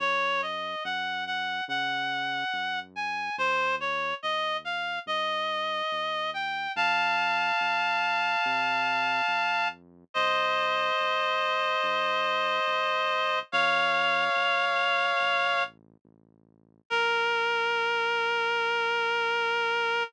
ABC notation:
X:1
M:4/4
L:1/8
Q:1/4=71
K:Bbm
V:1 name="Clarinet"
d e g g g3 a | c d e f e3 =g | [f=a]8 | [ce]8 |
[df]6 z2 | B8 |]
V:2 name="Synth Bass 1" clef=bass
G,,2 G,,2 D,2 G,,2 | E,,2 E,,2 =G,,2 E,,2 | F,,2 F,,2 C,2 F,,2 | C,,2 C,,2 G,,2 C,,2 |
F,,2 F,,2 =A,,,2 A,,,2 | B,,,8 |]